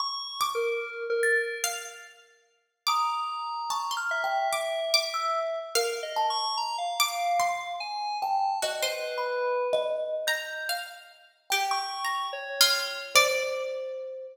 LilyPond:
<<
  \new Staff \with { instrumentName = "Pizzicato Strings" } { \time 7/8 \tempo 4 = 73 r8 d'''4. f''8 r4 | d'''16 r8. a''16 c'''8. d'''8 d'''4 | f''4. d'''8 c'''4. | ges'16 c''4.~ c''16 bes''8 f''4 |
\tuplet 3/2 { g'4 bes''4 f'4 } d''4. | }
  \new Staff \with { instrumentName = "Electric Piano 2" } { \time 7/8 \tuplet 3/2 { des'''4 bes'4 bes'4 } r4. | bes''4. e''2 | \tuplet 3/2 { bes'8 ees''8 des'''8 } bes''16 f''4~ f''16 aes''8 a''8 | r16 b'4~ b'16 r2 |
r16 des'''8. des''4 r4. | }
  \new Staff \with { instrumentName = "Kalimba" } { \time 7/8 r4. a'''16 r4. r16 | ees'''4 \tuplet 3/2 { des'''8 f'''8 g''8 } r8. e'''16 r8 | r8 a''8 r2 g''8 | \tuplet 3/2 { ees''4 b''4 ees''4 } g'''8 r4 |
g''2 c''4. | }
>>